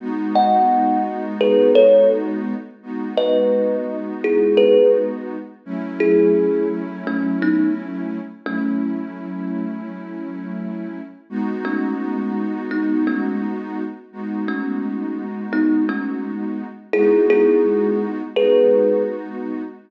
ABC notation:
X:1
M:4/4
L:1/8
Q:1/4=85
K:G#phr
V:1 name="Kalimba"
z [df]2 z [GB] [Ac] z2 | z [Bd]2 z [EG] [GB] z2 | z [EG]2 z [A,C] [B,D] z2 | [A,C]4 z4 |
z [A,C]2 z [B,D] [A,C] z2 | z [A,C]2 z [B,D] [A,C] z2 | [EG] [EG]2 z [GB]2 z2 |]
V:2 name="Pad 2 (warm)"
[G,B,DF]8 | [G,B,DF]8 | [F,A,CE]8 | [F,A,CE]8 |
[G,B,DF]8 | [G,B,DF]8 | [G,B,DF]4 [G,B,DF]4 |]